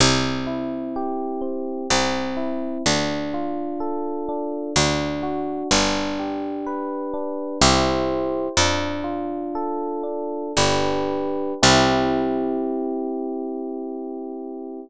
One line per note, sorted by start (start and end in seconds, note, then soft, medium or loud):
0.00 1.62 C2 medium
0.00 1.41 C4 medium
0.47 1.83 E4 medium
0.96 1.87 G4 medium
1.41 1.87 C4 medium
1.90 2.78 C2 medium
1.90 2.82 C4 medium
2.37 2.82 E4 medium
2.86 4.48 D2 medium
2.86 4.28 D4 medium
3.34 4.70 F4 medium
3.80 4.71 A4 medium
4.29 4.74 D4 medium
4.76 5.63 D2 medium
4.76 5.68 D4 medium
5.23 5.68 F#4 medium
5.71 7.33 G1 medium
5.71 7.13 D4 medium
6.19 7.55 G4 medium
6.66 7.57 B4 medium
7.14 7.59 D4 medium
7.62 8.49 C2 medium
7.62 8.47 E4 medium
7.62 8.47 G4 medium
7.62 8.47 C5 medium
8.57 10.25 F2 medium
8.57 10.03 D4 medium
9.04 10.47 F4 medium
9.55 10.52 A4 medium
10.03 10.52 D4 medium
10.57 11.55 G1 medium
10.57 11.53 D4 medium
10.57 11.53 G4 medium
10.57 11.53 B4 medium
11.63 14.80 C2 loud
11.63 14.80 C4 loud
11.63 14.80 E4 loud
11.63 14.80 G4 loud